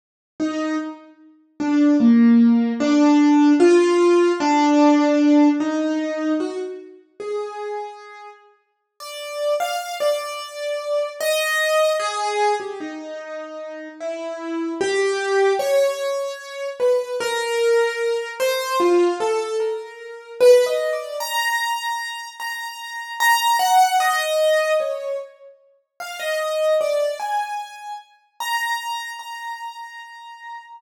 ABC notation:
X:1
M:7/8
L:1/16
Q:1/4=75
K:none
V:1 name="Acoustic Grand Piano"
z2 ^D2 z4 =D2 ^A,4 | D4 F4 D6 | ^D4 ^F z3 ^G6 | z3 d3 f2 d6 |
^d4 ^G3 =G ^D6 | E4 G4 ^c6 | B2 ^A6 c2 F2 =A2 | ^A4 (3B2 ^d2 =d2 ^a6 |
^a4 a2 ^f2 ^d4 ^c2 | z4 f ^d3 =d2 ^g4 | z2 ^a4 a8 |]